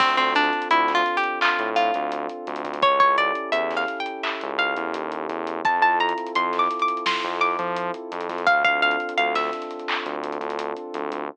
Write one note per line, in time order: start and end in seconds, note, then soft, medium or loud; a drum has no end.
0.00 0.15 D2 loud
0.00 0.16 C4 loud
0.00 2.77 C4 loud
0.00 2.77 D4 medium
0.00 2.77 F4 loud
0.00 2.77 A4 loud
0.00 kick loud
0.00 crash loud
0.17 0.50 D2 medium
0.17 0.34 C4 loud
0.17 closed hi-hat medium
0.35 0.68 D4 loud
0.35 closed hi-hat medium
0.44 closed hi-hat medium
0.53 closed hi-hat medium
0.62 closed hi-hat medium
0.70 1.02 D2 medium
0.70 0.93 E4 medium
0.70 closed hi-hat loud
0.88 snare medium
0.88 closed hi-hat medium
0.95 1.17 F4 loud
1.06 closed hi-hat medium
1.17 1.39 G4 medium
1.24 closed hi-hat medium
1.41 1.70 F4 medium
1.41 clap loud
1.59 1.91 A2 medium
1.59 closed hi-hat medium
1.76 2.78 F4 medium
1.76 closed hi-hat medium
1.94 2.27 D2 medium
1.94 closed hi-hat medium
2.12 closed hi-hat loud
2.29 closed hi-hat medium
2.47 2.64 D2 medium
2.47 closed hi-hat medium
2.56 closed hi-hat medium
2.65 2.81 D2 medium
2.65 closed hi-hat medium
2.74 closed hi-hat medium
2.82 2.99 C#2 medium
2.82 5.59 C#4 loud
2.82 5.59 E4 medium
2.82 5.59 G4 medium
2.82 5.59 A4 medium
2.82 2.99 C#5 loud
2.82 kick loud
2.82 closed hi-hat loud
3.00 3.32 C#2 medium
3.00 3.17 C#5 medium
3.00 kick medium
3.00 closed hi-hat medium
3.18 3.50 D5 loud
3.18 closed hi-hat medium
3.35 closed hi-hat medium
3.52 3.84 E2 medium
3.52 3.74 E5 medium
3.52 closed hi-hat loud
3.71 snare medium
3.71 closed hi-hat medium
3.77 3.99 F5 medium
3.88 closed hi-hat medium
4.00 4.22 G5 medium
4.06 closed hi-hat medium
4.23 4.53 E5 medium
4.23 clap loud
4.41 4.74 C#2 medium
4.41 closed hi-hat medium
4.59 5.62 F5 medium
4.59 closed hi-hat medium
4.76 4.93 E2 medium
4.76 closed hi-hat medium
4.94 5.27 D#2 medium
4.94 closed hi-hat loud
5.12 closed hi-hat medium
5.29 5.61 E2 medium
5.29 closed hi-hat medium
5.47 closed hi-hat medium
5.65 5.80 F2 loud
5.65 8.41 C4 medium
5.65 8.41 E4 medium
5.65 8.41 F4 loud
5.65 8.41 A4 loud
5.65 5.82 A5 loud
5.65 kick loud
5.65 closed hi-hat loud
5.81 6.13 F2 medium
5.81 5.99 A5 medium
5.81 closed hi-hat medium
6.00 6.32 A#5 medium
6.00 closed hi-hat medium
6.09 closed hi-hat medium
6.18 closed hi-hat medium
6.26 closed hi-hat medium
6.35 6.67 F2 medium
6.35 6.58 C6 medium
6.35 closed hi-hat loud
6.53 snare medium
6.53 closed hi-hat medium
6.59 6.81 D6 medium
6.71 closed hi-hat medium
6.79 7.04 D6 medium
6.79 closed hi-hat medium
6.88 closed hi-hat medium
6.97 closed hi-hat medium
7.06 7.38 C6 loud
7.06 snare loud
7.24 7.56 F2 loud
7.24 closed hi-hat medium
7.41 8.37 D6 medium
7.41 closed hi-hat medium
7.59 7.91 F3 loud
7.59 closed hi-hat medium
7.76 closed hi-hat loud
7.94 closed hi-hat medium
8.12 8.28 F2 medium
8.12 closed hi-hat medium
8.21 closed hi-hat medium
8.29 8.45 F2 medium
8.29 snare soft
8.29 closed hi-hat medium
8.38 closed hi-hat medium
8.47 8.63 D2 medium
8.47 11.24 C4 loud
8.47 11.24 D4 loud
8.47 11.24 F4 loud
8.47 11.24 A4 loud
8.47 8.63 F5 loud
8.47 kick loud
8.47 closed hi-hat loud
8.64 8.96 D2 medium
8.64 8.81 F5 loud
8.64 kick medium
8.64 closed hi-hat medium
8.82 9.14 F5 loud
8.82 closed hi-hat medium
8.91 closed hi-hat medium
9.00 closed hi-hat medium
9.09 closed hi-hat medium
9.17 9.50 D2 medium
9.17 9.34 F5 loud
9.17 closed hi-hat loud
9.35 10.12 E5 medium
9.35 snare medium
9.35 closed hi-hat medium
9.53 snare soft
9.53 closed hi-hat medium
9.62 closed hi-hat medium
9.71 closed hi-hat medium
9.79 closed hi-hat medium
9.88 clap loud
10.06 10.38 D2 medium
10.06 closed hi-hat medium
10.24 closed hi-hat medium
10.32 closed hi-hat medium
10.41 10.72 D2 loud
10.41 closed hi-hat medium
10.50 closed hi-hat medium
10.59 closed hi-hat loud
10.76 closed hi-hat medium
10.94 11.10 D2 medium
10.94 closed hi-hat medium
11.12 11.28 D2 medium
11.12 closed hi-hat medium